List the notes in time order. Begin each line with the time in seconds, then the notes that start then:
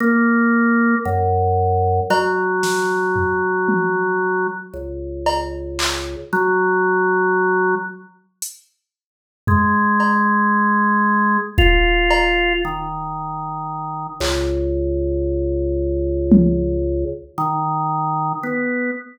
0.00 A#3
1.05 F#2
2.10 F#3, cowbell
2.63 snare
3.16 floor tom
3.68 high tom
4.73 C#2
5.26 cowbell
5.79 clap
6.33 F#3
8.42 closed hi-hat
9.47 G#3, floor tom
10.00 cowbell
11.58 F4, kick
12.11 cowbell
12.65 D#3
14.20 C#2, clap
16.32 high tom
17.38 D#3
18.43 B3